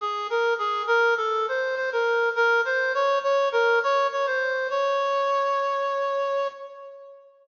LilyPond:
\new Staff { \time 4/4 \key des \major \tempo 4 = 102 aes'8 bes'8 aes'8 bes'8 a'8 c''8 c''16 bes'8. | bes'8 c''8 des''8 des''8 bes'8 des''8 des''16 c''8. | des''2.~ des''8 r8 | }